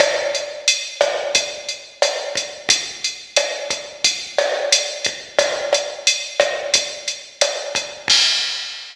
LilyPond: \new DrumStaff \drummode { \time 4/4 \tempo 4 = 89 <hh bd ss>8 hh8 hh8 <hh bd ss>8 <hh bd>8 hh8 <hh ss>8 <hh bd>8 | <hh bd>8 hh8 <hh ss>8 <hh bd>8 <hh bd>8 <hh ss>8 hh8 <hh bd>8 | <hh bd ss>8 <hh ss>8 hh8 <hh bd ss>8 <hh bd>8 hh8 <hh ss>8 <hh bd>8 | <cymc bd>4 r4 r4 r4 | }